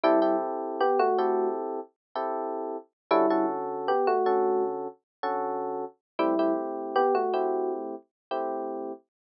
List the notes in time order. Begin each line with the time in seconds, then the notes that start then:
0.04 G3 C4 E4 G4 A4
0.22 C4 E4 G4 A4
0.81 B3 G4
0.99 A3 F#4
1.18 C4 E4 G4 A4
2.16 C4 E4 G4 A4
3.11 D3 G3 C#4 E4 F#4 A4
3.30 D3 C#4 F#4 A4
3.88 B3 G4
4.07 A3 F#4
4.26 D3 C#4 F#4 A4
5.23 D3 C#4 F#4 A4
6.19 G3 A3 C4 E4 G4
6.39 A3 C4 E4 G4
6.96 B3 G4
7.15 A3 F#4
7.33 A3 C4 E4 G4
8.31 A3 C4 E4 G4